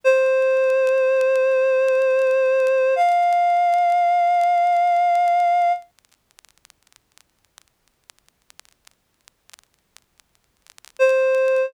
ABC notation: X:1
M:4/4
L:1/8
Q:1/4=82
K:F
V:1 name="Clarinet"
c8 | f8 | z8 | z6 c2 |]